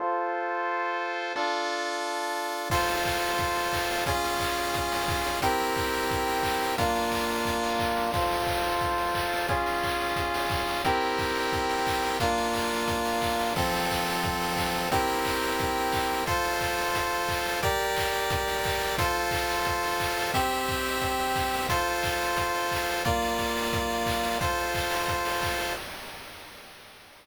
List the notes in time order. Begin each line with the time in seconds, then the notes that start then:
0.00 F4 A4 C5
1.36 D4 F4 A4
2.70 F4 A4 C5, kick, crash
2.88 open hi-hat
3.05 kick, clap
3.23 open hi-hat
3.38 kick, closed hi-hat
3.56 open hi-hat
3.73 kick, clap
3.90 open hi-hat
4.06 C#4 F4 G#4, kick, closed hi-hat
4.24 open hi-hat
4.39 kick, clap
4.58 open hi-hat
4.74 kick, closed hi-hat
4.92 open hi-hat
5.08 kick, clap
5.25 open hi-hat
5.42 C4 E4 G4 A#4, kick, closed hi-hat
5.60 open hi-hat
5.76 kick, clap
5.94 open hi-hat
6.11 kick, closed hi-hat
6.28 open hi-hat
6.43 kick, clap
6.61 open hi-hat
6.78 A#3 D4 F4, kick, closed hi-hat
6.95 open hi-hat
7.12 kick, clap
7.30 open hi-hat
7.45 kick, closed hi-hat
7.63 open hi-hat
7.79 kick, clap
7.96 open hi-hat
8.14 F4 A4 C5, kick, crash
8.31 open hi-hat
8.47 kick, clap
8.64 open hi-hat
8.81 kick, closed hi-hat
8.98 open hi-hat
9.15 kick, clap
9.33 open hi-hat
9.48 C#4 F4 G#4, kick, closed hi-hat
9.66 open hi-hat
9.83 kick, clap
10.00 open hi-hat
10.16 kick, closed hi-hat
10.34 open hi-hat
10.50 kick, clap
10.68 open hi-hat
10.85 C4 E4 G4 A#4, kick, closed hi-hat
11.01 open hi-hat
11.18 kick, clap
11.35 open hi-hat
11.53 kick, closed hi-hat
11.70 open hi-hat
11.87 kick, clap
12.04 open hi-hat
12.20 A#3 D4 F4, kick, closed hi-hat
12.38 open hi-hat
12.54 kick, clap
12.71 open hi-hat
12.88 kick, closed hi-hat
13.05 open hi-hat
13.22 kick, clap
13.39 open hi-hat
13.56 F3 C4 A4, kick, crash
13.74 open hi-hat
13.90 kick, clap
14.06 open hi-hat
14.23 kick, closed hi-hat
14.41 open hi-hat
14.57 kick, clap
14.74 open hi-hat
14.92 C4 E4 G4 A#4, kick, closed hi-hat
15.08 open hi-hat
15.25 kick, clap
15.43 open hi-hat
15.59 kick, closed hi-hat
15.76 open hi-hat
15.92 kick, clap
16.10 open hi-hat
16.26 F4 A4 C5, kick, closed hi-hat
16.44 open hi-hat
16.61 kick, clap
16.77 open hi-hat
16.95 kick, closed hi-hat
17.11 open hi-hat
17.28 kick, clap
17.45 open hi-hat
17.63 G4 A#4 D5, kick, closed hi-hat
17.79 open hi-hat
17.96 kick, clap
18.13 open hi-hat
18.30 kick, closed hi-hat
18.48 open hi-hat
18.64 kick, clap
18.80 open hi-hat
18.98 F4 A4 C5, kick, closed hi-hat
19.15 open hi-hat
19.31 kick, clap
19.49 open hi-hat
19.65 kick, closed hi-hat
19.83 open hi-hat
20.00 kick, clap
20.17 open hi-hat
20.34 C4 G4 E5, kick, closed hi-hat
20.51 open hi-hat
20.68 kick, clap
20.85 open hi-hat
21.01 kick, closed hi-hat
21.19 open hi-hat
21.36 kick, clap
21.54 open hi-hat
21.69 F4 A4 C5, kick, closed hi-hat
21.87 open hi-hat
22.03 kick, clap
22.21 open hi-hat
22.36 kick, closed hi-hat
22.54 open hi-hat
22.71 kick, clap
22.88 open hi-hat
23.05 A#3 F4 D5, kick, closed hi-hat
23.22 open hi-hat
23.38 kick, clap
23.56 open hi-hat
23.73 kick, closed hi-hat
23.90 open hi-hat
24.06 kick, clap
24.24 open hi-hat
24.41 F4 A4 C5, kick, closed hi-hat
24.58 open hi-hat
24.75 kick, clap
24.90 open hi-hat
25.08 kick, closed hi-hat
25.25 open hi-hat
25.42 kick, clap
25.60 open hi-hat